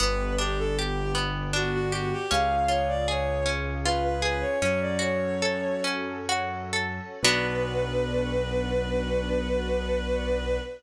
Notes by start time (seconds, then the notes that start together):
0.00 G1 B3 D4 G4 B4
0.38 D4 G4
0.58 A4
0.79 G4
1.15 B3
1.53 D4 F#4
1.74 F#4
1.92 F#4 G4
2.13 G4
2.30 C#2 C#4 F4 G#4 F5
2.68 F4 C#5
2.88 D5
3.08 G#4 C#5
3.46 C#4
3.85 F4 B4
4.04 B4
4.22 G#4 B4
4.41 C#5
4.61 F#2 C#4 F#4 A4 C#5
4.81 D5
4.99 F#4 C#5
5.42 A4
5.84 C#4
6.29 F#4
6.73 A4
7.22 B1 B3 D4 F#4 B4